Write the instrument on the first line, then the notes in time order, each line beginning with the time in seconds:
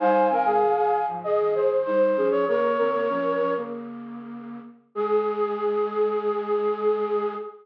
flute
0.00 G3 D#4 C5 F5 G#5
0.30 D#3 C4 A#4
0.45 C3 G#3 G#4
0.61 G2 D#3
0.77 G#4
1.08 G#2 F3
1.24 F2 C#3 G#4 D#5
1.40 G2 D#3
1.54 G2 D#3 G#4 C5
1.85 G3 D#4 C5
2.17 F3 C#4 G#4
2.31 F3 C#4 C#5
2.48 C#3 A#3 A#4 C#5
2.63 A#4
2.78 D#3 C4 A#4
2.93 C#3 A#3
3.09 F3 C#4
3.40 F3 C#4
3.57 C#3 A#3
4.95 G#3 G#4